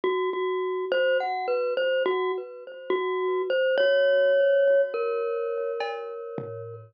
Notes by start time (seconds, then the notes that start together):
0.04 F#4
0.33 F#4
0.92 C5
1.20 F#5
1.48 B4
1.77 C5
2.06 F#4
2.90 F#4
3.50 C5
3.78 C#5
4.94 A#4
5.81 cowbell
6.38 floor tom